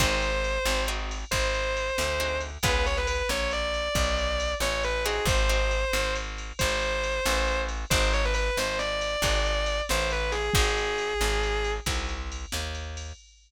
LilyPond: <<
  \new Staff \with { instrumentName = "Distortion Guitar" } { \time 12/8 \key aes \major \tempo 4. = 91 c''2 r4 c''2~ c''8 r8 | ces''8 des''16 ces''16 ces''8 des''8 d''2~ d''8 des''8 ces''8 aes'8 | c''2 r4 c''2~ c''8 r8 | c''8 des''16 b'16 b'8 c''8 d''2~ d''8 c''8 b'8 aes'8 |
aes'2. r2. | }
  \new Staff \with { instrumentName = "Acoustic Guitar (steel)" } { \time 12/8 \key aes \major <c' ees' ges' aes'>2 <c' ees' ges' aes'>2. <c' ees' ges' aes'>4 | <ces' des' f' aes'>1~ <ces' des' f' aes'>4. <c' ees' ges' aes'>8~ | <c' ees' ges' aes'>8 <c' ees' ges' aes'>1~ <c' ees' ges' aes'>4. | <c' ees' ges' aes'>2. <c' ees' ges' aes'>2. |
<c' ees' ges' aes'>2. <c' ees' ges' aes'>2. | }
  \new Staff \with { instrumentName = "Electric Bass (finger)" } { \clef bass \time 12/8 \key aes \major aes,,4. aes,,4. aes,,4. d,4. | des,4. bes,,4. ces,4. a,,4. | aes,,4. aes,,4. aes,,4. a,,4. | aes,,4. aes,,4. aes,,4. a,,4. |
aes,,4. aes,,4. c,4. ees,4. | }
  \new DrumStaff \with { instrumentName = "Drums" } \drummode { \time 12/8 <cymc bd>8 cymr8 cymr8 sn8 cymr8 cymr8 <bd cymr>8 cymr8 cymr8 sn8 cymr8 cymr8 | <bd cymr>8 cymr8 cymr8 sn8 cymr8 cymr8 <bd cymr>8 cymr8 cymr8 sn8 cymr8 cymr8 | <bd cymr>8 cymr8 cymr8 sn8 cymr8 cymr8 <bd cymr>8 cymr8 cymr8 sn8 cymr8 cymr8 | <bd cymr>8 cymr8 cymr8 sn8 cymr8 cymr8 <bd cymr>8 cymr8 cymr8 sn8 cymr8 cymr8 |
<bd cymr>8 cymr8 cymr8 sn8 cymr8 cymr8 <bd cymr>8 cymr8 cymr8 sn8 cymr8 cymr8 | }
>>